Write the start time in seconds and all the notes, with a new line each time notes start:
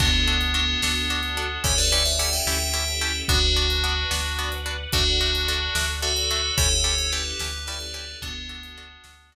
0.00 D2 B3 D4 F#4 A4, kick, crash
0.27 D4 F#4 A4
0.41 closed hi-hat
0.54 B3 D4 F#4 A4
0.82 D2 B3 D4 F#4 A4, snare
1.10 D4 F#4 A4
1.23 closed hi-hat
1.37 D4 F#4 A4
1.64 D2 C#4 E4 G4 A4 C#5, kick, closed hi-hat
1.78 B4 D5
1.92 C#4 E4 G4 A4 B4 D5
2.06 C#5 E5, closed hi-hat
2.19 C#4 E4 G4 A4 D5 F#5
2.33 E5 G5
2.47 D2 C#4 E4 G4 A4, snare
2.74 C#4 E4 G4 A4
2.88 closed hi-hat
3.01 C#4 E4 G4 A4
3.28 D2 B3 D4 F#4 B4 D5 F#5, kick, closed hi-hat
3.56 B3 D4 F#4
3.70 closed hi-hat
3.84 B3 D4 F#4
4.11 D2 B3 D4 F#4, snare
4.39 B3 D4 F#4
4.52 closed hi-hat
4.66 B3 D4 F#4
4.92 D2 A3 D4 F#4 A4 D5 F#5, kick, closed hi-hat
5.21 A3 D4 F#4
5.35 closed hi-hat
5.48 A3 D4 F#4
5.75 D2 A3 D4 F#4, snare
6.02 A3 D4 F#4 A4
6.17 closed hi-hat
6.31 A3 D4 F#4
6.57 D2 C#4 E4 G4 A4 C#5, kick, closed hi-hat
6.84 C#4 E4 G4 A4
6.99 closed hi-hat
7.12 C#4 E4 G4 A4 B4
7.39 D2 C#4 E4 G4 A4, snare
7.67 C#4 E4 G4 A4 B4 D5
7.80 closed hi-hat
7.94 C#4 E4 G4 A4
8.21 D2 B3 D4 F#4 A4, kick, closed hi-hat
8.49 D4 F#4 A4
8.63 closed hi-hat
8.78 D4 F#4 A4
9.04 D2 D4 F#4 A4, snare
9.32 D4 F#4 A4